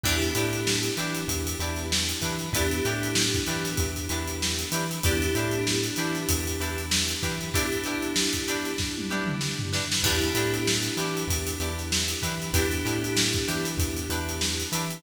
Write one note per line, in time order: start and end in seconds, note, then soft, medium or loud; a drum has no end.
0.04 0.32 E2 medium
0.04 2.49 B3 medium
0.04 2.49 D4 medium
0.04 0.16 D4 medium
0.04 2.49 E4 medium
0.04 0.16 E4 medium
0.04 2.49 G4 medium
0.04 0.16 G4 medium
0.04 0.16 B4 medium
0.04 kick loud
0.04 crash loud
0.22 closed hi-hat medium
0.35 0.89 A2 medium
0.35 0.58 D4 medium
0.35 0.58 E4 medium
0.35 0.58 G4 medium
0.35 0.58 B4 medium
0.35 closed hi-hat medium
0.53 closed hi-hat medium
0.67 snare loud
0.83 snare soft
0.83 closed hi-hat medium
0.96 1.24 E3 medium
0.96 1.21 D4 medium
0.96 1.21 E4 medium
0.96 1.21 G4 medium
0.96 1.21 B4 medium
0.96 snare soft
0.96 closed hi-hat medium
1.15 closed hi-hat medium
1.28 1.55 E2 medium
1.28 kick medium
1.28 closed hi-hat loud
1.47 closed hi-hat medium
1.59 2.14 E2 medium
1.59 1.83 D4 medium
1.59 1.83 E4 medium
1.59 1.83 G4 medium
1.59 1.83 B4 medium
1.59 closed hi-hat medium
1.76 snare soft
1.76 closed hi-hat medium
1.92 snare loud
2.09 closed hi-hat medium
2.21 2.49 E3 medium
2.21 2.35 D4 medium
2.21 2.35 E4 medium
2.21 2.35 G4 medium
2.21 2.35 B4 medium
2.21 kick medium
2.21 closed hi-hat medium
2.39 closed hi-hat medium
2.53 2.80 E2 medium
2.53 5.00 B3 medium
2.53 5.00 D4 medium
2.53 2.66 D4 medium
2.53 5.00 E4 medium
2.53 2.66 E4 medium
2.53 5.00 G4 medium
2.53 2.66 G4 medium
2.53 2.66 B4 loud
2.53 kick loud
2.53 closed hi-hat loud
2.71 closed hi-hat medium
2.85 3.39 A2 medium
2.85 3.08 D4 medium
2.85 3.08 E4 medium
2.85 3.08 G4 medium
2.85 3.08 B4 medium
2.85 closed hi-hat medium
3.03 closed hi-hat medium
3.15 snare loud
3.34 kick medium
3.34 closed hi-hat medium
3.46 3.74 E3 medium
3.46 3.71 D4 medium
3.46 3.71 E4 medium
3.46 3.71 G4 medium
3.46 3.71 B4 medium
3.46 closed hi-hat medium
3.64 snare soft
3.64 closed hi-hat medium
3.77 4.06 E2 medium
3.77 kick loud
3.77 closed hi-hat medium
3.96 closed hi-hat medium
4.09 4.64 E2 medium
4.09 4.33 D4 medium
4.09 4.33 E4 medium
4.09 4.33 G4 medium
4.09 4.33 B4 medium
4.09 closed hi-hat medium
4.27 closed hi-hat medium
4.42 snare loud
4.59 closed hi-hat medium
4.72 4.99 E3 medium
4.72 4.85 D4 medium
4.72 4.85 E4 medium
4.72 4.85 G4 medium
4.72 4.85 B4 medium
4.72 closed hi-hat medium
4.91 closed hi-hat medium
5.03 5.31 E2 medium
5.03 7.51 B3 medium
5.03 7.51 D4 medium
5.03 5.16 D4 medium
5.03 7.51 E4 medium
5.03 5.16 E4 medium
5.03 5.16 G4 loud
5.03 7.51 G4 medium
5.03 5.16 B4 medium
5.03 kick loud
5.03 closed hi-hat loud
5.22 closed hi-hat medium
5.35 5.89 A2 medium
5.35 5.58 D4 medium
5.35 5.58 E4 medium
5.35 5.58 G4 medium
5.35 5.58 B4 medium
5.35 closed hi-hat medium
5.51 closed hi-hat medium
5.67 snare loud
5.83 closed hi-hat medium
5.96 6.24 E3 medium
5.96 6.21 D4 medium
5.96 6.21 E4 medium
5.96 6.21 G4 medium
5.96 6.21 B4 medium
5.96 closed hi-hat medium
6.15 closed hi-hat medium
6.29 6.56 E2 medium
6.29 kick medium
6.29 closed hi-hat loud
6.47 closed hi-hat medium
6.60 7.14 E2 medium
6.60 6.83 D4 medium
6.60 6.83 E4 medium
6.60 6.83 G4 medium
6.60 6.83 B4 medium
6.60 closed hi-hat medium
6.78 closed hi-hat medium
6.91 snare loud
7.08 closed hi-hat medium
7.23 7.50 E3 medium
7.23 7.35 D4 medium
7.23 7.35 E4 medium
7.23 7.35 G4 medium
7.23 7.35 B4 medium
7.23 kick medium
7.23 closed hi-hat medium
7.41 closed hi-hat medium
7.53 9.99 B3 medium
7.53 9.99 D4 medium
7.53 7.66 D4 medium
7.53 9.99 E4 medium
7.53 7.66 E4 loud
7.53 9.99 G4 medium
7.53 7.66 G4 medium
7.53 7.66 B4 loud
7.53 kick loud
7.53 closed hi-hat loud
7.72 closed hi-hat medium
7.84 8.08 D4 medium
7.84 8.08 E4 medium
7.84 8.08 G4 medium
7.84 8.08 B4 medium
7.84 closed hi-hat medium
8.02 closed hi-hat medium
8.16 snare loud
8.33 kick medium
8.33 closed hi-hat medium
8.48 8.71 D4 medium
8.48 8.71 E4 medium
8.48 8.71 G4 medium
8.48 8.71 B4 medium
8.48 closed hi-hat medium
8.65 closed hi-hat medium
8.78 kick medium
8.78 snare medium
8.98 high tom medium
9.10 9.33 D4 medium
9.10 9.33 E4 medium
9.10 9.33 G4 medium
9.10 9.33 B4 medium
9.26 mid tom medium
9.41 snare medium
9.59 floor tom medium
9.73 9.85 D4 medium
9.73 9.85 E4 medium
9.73 9.85 G4 medium
9.73 9.85 B4 medium
9.73 snare medium
9.92 snare loud
10.03 10.30 E2 medium
10.03 12.50 B3 medium
10.03 12.50 D4 medium
10.03 10.16 D4 medium
10.03 12.50 E4 medium
10.03 10.16 E4 medium
10.03 12.50 G4 medium
10.03 10.16 G4 medium
10.03 10.16 B4 medium
10.03 kick loud
10.03 crash loud
10.21 closed hi-hat medium
10.35 10.89 A2 medium
10.35 10.58 D4 medium
10.35 10.58 E4 medium
10.35 10.58 G4 medium
10.35 10.58 B4 medium
10.35 closed hi-hat medium
10.54 closed hi-hat medium
10.67 snare loud
10.83 snare soft
10.83 closed hi-hat medium
10.97 11.24 E3 medium
10.97 11.21 D4 medium
10.97 11.21 E4 medium
10.97 11.21 G4 medium
10.97 11.21 B4 medium
10.97 snare soft
10.97 closed hi-hat medium
11.17 closed hi-hat medium
11.27 11.55 E2 medium
11.27 kick medium
11.27 closed hi-hat loud
11.47 closed hi-hat medium
11.60 12.14 E2 medium
11.60 11.83 D4 medium
11.60 11.83 E4 medium
11.60 11.83 G4 medium
11.60 11.83 B4 medium
11.60 closed hi-hat medium
11.79 snare soft
11.79 closed hi-hat medium
11.92 snare loud
12.08 closed hi-hat medium
12.22 12.50 E3 medium
12.22 12.35 D4 medium
12.22 12.35 E4 medium
12.22 12.35 G4 medium
12.22 12.35 B4 medium
12.22 kick medium
12.22 closed hi-hat medium
12.42 closed hi-hat medium
12.53 12.80 E2 medium
12.53 15.00 B3 medium
12.53 15.00 D4 medium
12.53 12.66 D4 medium
12.53 15.00 E4 medium
12.53 12.66 E4 medium
12.53 15.00 G4 medium
12.53 12.66 G4 medium
12.53 12.66 B4 loud
12.53 kick loud
12.53 closed hi-hat loud
12.71 closed hi-hat medium
12.85 13.39 A2 medium
12.85 13.08 D4 medium
12.85 13.08 E4 medium
12.85 13.08 G4 medium
12.85 13.08 B4 medium
12.85 closed hi-hat medium
13.04 closed hi-hat medium
13.17 snare loud
13.33 kick medium
13.33 closed hi-hat medium
13.48 13.76 E3 medium
13.48 13.71 D4 medium
13.48 13.71 E4 medium
13.48 13.71 G4 medium
13.48 13.71 B4 medium
13.48 closed hi-hat medium
13.65 snare soft
13.65 closed hi-hat medium
13.77 14.04 E2 medium
13.77 kick loud
13.77 closed hi-hat medium
13.97 closed hi-hat medium
14.09 14.64 E2 medium
14.09 14.33 D4 medium
14.09 14.33 E4 medium
14.09 14.33 G4 medium
14.09 14.33 B4 medium
14.09 closed hi-hat medium
14.29 closed hi-hat medium
14.41 snare loud
14.60 closed hi-hat medium
14.72 14.99 E3 medium
14.72 14.85 D4 medium
14.72 14.85 E4 medium
14.72 14.85 G4 medium
14.72 14.85 B4 medium
14.72 closed hi-hat medium
14.90 closed hi-hat medium